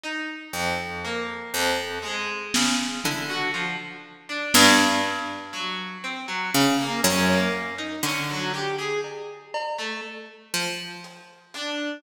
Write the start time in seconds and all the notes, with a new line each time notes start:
0.04 D#4
0.53 F2
1.05 A#3
1.54 F2
2.02 G#3
2.54 C#3, snare
3.04 D3 E4, floor tom
3.29 F#4
3.54 F3
4.29 D4
4.54 G2, snare
5.04 clap
5.53 F#3
6.04 C4
6.28 F#3
6.54 C#3
6.79 A#3
7.04 F#2 C#4, closed hi-hat
7.30 A#3
7.78 D#4
8.03 D3 C#4, clap
8.30 F#3
8.54 G4
8.78 G#4
9.04 cowbell
9.54 cowbell
9.79 A3
10.54 F3
11.04 closed hi-hat
11.54 D4, closed hi-hat